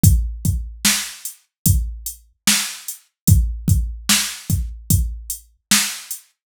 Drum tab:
HH |xx-xxx-x|xx-xxx-x|
SD |--o---o-|--o---o-|
BD |oo--o---|oo-oo---|